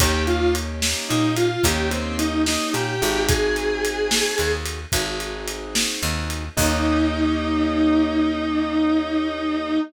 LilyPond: <<
  \new Staff \with { instrumentName = "Distortion Guitar" } { \time 12/8 \key ees \major \tempo 4. = 73 g'8 f'8 r4 ees'8 f'8 g'8 c'8 ees'8 ees'8 g'4 | aes'2~ aes'8 r2. r8 | ees'1. | }
  \new Staff \with { instrumentName = "Acoustic Grand Piano" } { \time 12/8 \key ees \major <bes des' ees' g'>2. <bes des' ees' g'>2~ <bes des' ees' g'>8 <c' ees' ges' aes'>8~ | <c' ees' ges' aes'>2. <c' ees' ges' aes'>2. | <bes des' ees' g'>1. | }
  \new Staff \with { instrumentName = "Electric Bass (finger)" } { \clef bass \time 12/8 \key ees \major ees,2 bes,4 ees,2 bes,8 aes,,8~ | aes,,2 ees,4 aes,,2 ees,4 | ees,1. | }
  \new DrumStaff \with { instrumentName = "Drums" } \drummode { \time 12/8 <bd cymr>8 cymr8 cymr8 sn8 cymr8 cymr8 <bd cymr>8 cymr8 cymr8 sn8 cymr8 cymr8 | <bd cymr>8 cymr8 cymr8 sn8 cymr8 cymr8 <bd cymr>8 cymr8 cymr8 sn8 cymr8 cymr8 | <cymc bd>4. r4. r4. r4. | }
>>